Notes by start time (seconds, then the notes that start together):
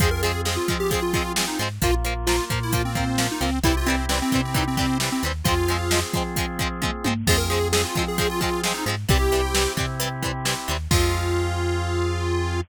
0.00 F2 F3 G#3 C4 F4 G#4, kick, closed hi-hat
0.11 A#4
0.22 F3 G#3 C4 G#4, closed hi-hat
0.45 F3 G#3 C4 G#4, snare
0.57 F4
0.68 F3 G#3 C4, kick, closed hi-hat
0.80 G4
0.91 F3 G#3 C4 G#4, kick, closed hi-hat
1.02 F4
1.13 F3 G#3 C4 F4, kick, closed hi-hat
1.36 F3 G#3 C4, snare
1.48 D#4
1.59 G#2 F3 G#3 C4, closed hi-hat
1.82 A#1 F3 A#3 F4, kick, closed hi-hat
2.05 F3 A#3, closed hi-hat
2.27 F3 A#3 F4, snare
2.50 A#2 F3 A#3, kick, closed hi-hat
2.63 E4
2.72 F3 A#3 F4, kick, closed hi-hat
2.85 C4
2.95 F3 A#3, kick, closed hi-hat
3.18 F3 A#3, snare
3.32 D#4
3.41 C#2 F3 A#3 C4, closed hi-hat
3.63 C2 E3 G3 C4 E4 G4, kick, closed hi-hat
3.77 F4
3.86 E3 G3 C4, closed hi-hat
4.09 E3 G3 C4, snare
4.22 C4
4.32 C3 E3 G3 C4, kick, closed hi-hat
4.45 C4
4.54 E3 G3 C4 D#4, kick, closed hi-hat
4.67 C4
4.77 E3 G3 C4, kick, closed hi-hat
5.00 E3 G3 C4, snare
5.12 C4
5.23 D#2 E3 G3 C4, closed hi-hat
5.44 F2 F3 G#3 C4 F4 G#4, kick, closed hi-hat
5.48 C4
5.68 F3 G#3 C4, closed hi-hat
5.91 F3 G#3 C4, snare
6.13 F3 G#3 C4, kick, closed hi-hat
6.36 F3 G#3 C4, kick, closed hi-hat
6.59 F3 G#3 C4, kick, closed hi-hat
6.82 F3 G#3 C4, kick, high tom
7.04 G#2 F3 G#3 C4, high tom
7.27 F2 F3 G#3 C4 F4 G#4, kick, crash
7.37 A#4
7.50 F3 G#3 C4 G#4, closed hi-hat
7.72 F3 G#3 C4 G#4, snare
7.85 F4
7.95 F3 G#3 C4, kick, closed hi-hat
8.08 G#4
8.18 F3 G#3 C4 G#4, kick, closed hi-hat
8.29 F4
8.41 F3 G#3 C4 F4, kick, closed hi-hat
8.64 F3 G#3 C4, snare
8.74 D#4
8.86 G#2 F3 G#3 C4, closed hi-hat
9.09 C2 E3 G3 C4 E4 G4, kick, closed hi-hat
9.32 E3 G3 C4, closed hi-hat
9.55 E3 G3 C4, snare
9.77 C3 E3 G3 C4, kick, closed hi-hat
10.00 E3 G3 C4, closed hi-hat
10.23 E3 G3 C4, kick, closed hi-hat
10.45 E3 G3 C4, snare
10.68 D#2 E3 G3 C4, closed hi-hat
10.91 F2 F3 G#3 C4 F4 G#4, kick, crash